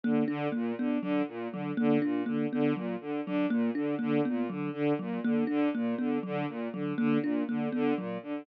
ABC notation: X:1
M:4/4
L:1/8
Q:1/4=121
K:none
V:1 name="Violin" clef=bass
D, D, | _B,, D, D, B,, D, D, B,, D, | D, _B,, D, D, B,, D, D, B,, | D, D, _B,, D, D, B,, D, D, |
_B,, D, D, B,, D, D, B,, D, |]
V:2 name="Kalimba"
_B, D | _B, =B, _G, z G, _B, D B, | B, _G, z G, _B, D B, =B, | _G, z G, _B, D B, =B, G, |
z _G, _B, D B, =B, G, z |]